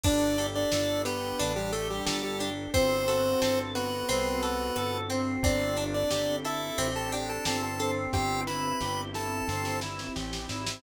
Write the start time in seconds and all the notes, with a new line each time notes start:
0.04 G1 D4 G4 A4 D5, kick, crash
0.38 G4 A4, ride
0.55 D4 D5
0.72 G1 D4 A4, snare
1.05 B3 G4 B4, ride
1.39 A1 D4, ride
1.56 G3 G4
1.72 A3 G4 A4, ride
1.90 G3 G4
2.06 G1 G3 G4 A4, snare
2.23 G3 G4
2.39 D4 G4, ride
2.73 G1 C4 F#4 A4 C5, kick, ride
3.08 F#4 A4, ride
3.41 G1 C4 A4, snare
3.75 B3 F#4 B4, ride
4.09 C2 C4, ride
4.43 F#4 A4, ride
4.76 G1 F#4 A4, cross-stick
5.10 C4, ride
5.43 G1 C4 D4 G4 A4 D5, kick, ride
5.77 D4, ride
5.94 D4 D5
6.11 G1 G4, snare
6.45 E4 A4 E5, ride
6.78 A1 C4 G4, ride
6.96 A4 A5
7.12 D4 G4 G5, ride
7.29 A4 A5
7.45 G1 C4 G4 A4 A5, snare
7.63 A4 A5
7.79 C4 A4, ride
8.13 G1 C4 E4 G4 G5, kick, snare
8.47 E4 B4 B5, snare
8.81 G1 G4, snare
9.14 E4 A4 A5, snare
9.48 G1 C4, snare
9.65 snare
9.81 E4, snare
9.99 snare
10.15 A1 G4, snare
10.33 snare
10.49 G#1 E4, snare
10.67 snare